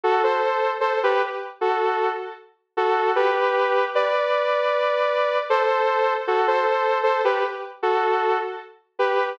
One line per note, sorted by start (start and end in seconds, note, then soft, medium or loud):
0.04 0.22 F#4 medium
0.04 0.22 A4 medium
0.24 0.71 A4 medium
0.24 0.71 C5 medium
0.81 0.99 A4 medium
0.81 0.99 C5 medium
1.03 1.22 G4 medium
1.03 1.22 B4 medium
1.61 2.09 F#4 medium
1.61 2.09 A4 medium
2.77 3.12 F#4 medium
2.77 3.12 A4 medium
3.16 3.85 G4 medium
3.16 3.85 B4 medium
3.95 5.38 B4 medium
3.95 5.38 D5 medium
5.50 6.13 A4 medium
5.50 6.13 C5 medium
6.27 6.46 F#4 medium
6.27 6.46 A4 medium
6.48 6.98 A4 medium
6.48 6.98 C5 medium
7.03 7.22 A4 medium
7.03 7.22 C5 medium
7.25 7.43 G4 medium
7.25 7.43 B4 medium
7.83 8.37 F#4 medium
7.83 8.37 A4 medium
8.99 9.32 G4 medium
8.99 9.32 B4 medium